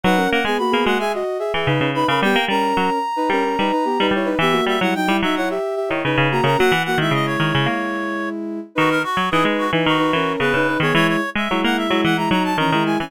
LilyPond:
<<
  \new Staff \with { instrumentName = "Clarinet" } { \time 4/4 \key b \major \tempo 4 = 110 fis''8 fis''16 gis''16 b''8 fis''16 gis''16 r4. b''16 b''16 | g''8 ais''2. r8 | e''8 e''16 fis''16 g''8 e''16 fis''16 r4. ais''16 ais''16 | fis''8 fis''16 e''16 dis''16 cis''2~ cis''16 r8 |
fis'16 ais'16 fis'8 gis'16 r16 fis'16 r16 fis'4 b'8. cis''16 | cis''16 cis''8 e''8 fis''16 e''8 fis''16 ais''16 ais''16 a''16 ais''8 gis''16 gis''16 | }
  \new Staff \with { instrumentName = "Ocarina" } { \time 4/4 \key b \major <dis' b'>16 <cis' ais'>8 <b gis'>16 <ais fis'>16 <b gis'>16 <ais fis'>16 <gis' e''>16 <fis' dis''>8 <gis' e''>16 <gis' e''>16 <dis' b'>8 <dis' b'>16 <cis' ais'>16 | <b g'>16 r16 <cis' ais'>4 r16 <dis' b'>16 <cis' ais'>16 <cis' ais'>16 <dis' b'>16 <dis' b'>16 <b g'>16 <dis' b'>16 <e' cis''>16 <dis' b'>16 | <b g'>16 <ais fis'>8 <g e'>16 <fis dis'>16 <g e'>16 <fis dis'>16 <e' cis''>16 <g' e''>8 <g' e''>16 <e' cis''>16 <dis' b'>8 <ais fis'>16 <cis' ais'>16 | <ais fis'>16 r16 <ais fis'>16 <gis e'>2.~ <gis e'>16 |
<dis' b'>8 r8 <dis' b'>8. <dis' b'>8 <dis' b'>16 <cis' ais'>8 <b gis'>16 <dis' b'>16 <dis' b'>16 <b gis'>16 | <gis e'>8 r8 <gis e'>8. <gis e'>8 <gis e'>16 <fis dis'>8 <e cis'>16 <gis e'>16 <gis e'>16 <e cis'>16 | }
  \new Staff \with { instrumentName = "Pizzicato Strings" } { \time 4/4 \key b \major fis8 ais16 gis16 r16 ais16 gis8. r8 e16 cis16 cis8 cis16 | g16 ais16 g8 fis16 r8. g8 g16 r8 g16 g8 | e8 g16 fis16 r16 g16 fis8. r8 dis16 cis16 cis8 cis16 | fis16 e8 dis16 cis8 dis16 cis16 ais4. r8 |
dis8 r16 fis16 e16 gis8 e16 dis8 e8 cis16 cis8 dis16 | e8 r16 gis16 fis16 ais8 fis16 e8 fis8 dis16 dis8 e16 | }
>>